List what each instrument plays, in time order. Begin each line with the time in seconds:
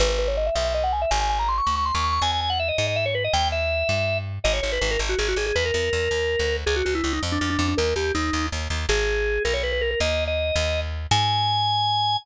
0.00 electric bass (finger) G#1, drawbar organ B4
0.09 drawbar organ B4
0.19 drawbar organ B4
0.28 drawbar organ C#5
0.37 drawbar organ D#5
0.46 drawbar organ E5
0.55 electric bass (finger) B1, drawbar organ E5
0.64 drawbar organ E5
0.74 drawbar organ D#5
0.84 drawbar organ F#5
0.93 drawbar organ G#5
1.02 drawbar organ E5
1.11 electric bass (finger) G#1, drawbar organ G#5
1.21 drawbar organ G#5
1.30 drawbar organ G#5
1.39 drawbar organ A#5
1.48 drawbar organ C6
1.58 drawbar organ C#6
1.67 electric bass (finger) D2, drawbar organ C#6
1.76 drawbar organ C#6
1.85 drawbar organ C6
1.95 electric bass (finger) D#2, drawbar organ C#6
2.04 drawbar organ C#6
2.13 drawbar organ C#6
2.22 electric bass (finger) E2, drawbar organ G#5
2.32 drawbar organ G#5
2.41 drawbar organ G#5
2.50 drawbar organ F#5
2.59 drawbar organ E5
2.68 drawbar organ D#5
2.78 electric bass (finger) G#2, drawbar organ D#5
2.87 drawbar organ D#5
2.96 drawbar organ E5
3.06 drawbar organ C#5
3.15 drawbar organ B4
3.24 drawbar organ D#5
3.33 electric bass (finger) D#2, drawbar organ G5
3.52 drawbar organ E5
3.89 electric bass (finger) G2
4.44 electric bass (finger) G#1, drawbar organ D#5
4.53 drawbar organ C#5
4.62 electric bass (finger) G#1, drawbar organ C#5
4.72 drawbar organ B4
4.81 electric bass (finger) G#1, drawbar organ B4
4.91 drawbar organ A#4
4.99 electric bass (finger) G#1
5.09 drawbar organ F#4
5.19 electric bass (finger) G#1, drawbar organ G#4
5.28 drawbar organ F#4
5.36 electric bass (finger) G#1, drawbar organ G#4
5.46 drawbar organ G#4
5.56 electric bass (finger) E2, drawbar organ B4
5.65 drawbar organ A#4
5.74 electric bass (finger) E2, drawbar organ A#4
5.93 electric bass (finger) E2
6.11 electric bass (finger) D#2
6.39 electric bass (finger) D2
6.66 electric bass (finger) C#2, drawbar organ G#4
6.76 drawbar organ F#4
6.85 electric bass (finger) C#2, drawbar organ F#4
6.95 drawbar organ E4
7.04 electric bass (finger) C#2, drawbar organ E4
7.13 drawbar organ D#4
7.23 electric bass (finger) F2
7.32 drawbar organ D4
7.41 electric bass (finger) F2, drawbar organ D4
7.50 drawbar organ D4
7.59 electric bass (finger) F2, drawbar organ D4
7.68 drawbar organ D4
7.77 electric bass (finger) D#2, drawbar organ A#4
7.96 electric bass (finger) D#2, drawbar organ G4
8.15 electric bass (finger) D#2, drawbar organ D#4
8.33 electric bass (finger) D#2
8.52 electric bass (finger) D#2
8.70 electric bass (finger) D#2
8.89 electric bass (finger) G#1, drawbar organ G#4
9.45 electric bass (finger) B1, drawbar organ A#4
9.54 drawbar organ C#5
9.63 drawbar organ B4
9.72 drawbar organ B4
9.81 drawbar organ A#4
9.91 drawbar organ A#4
10.00 electric bass (finger) D#2, drawbar organ D#5
10.27 drawbar organ D#5
10.56 electric bass (finger) D#2
11.11 electric bass (finger) G#2, drawbar organ G#5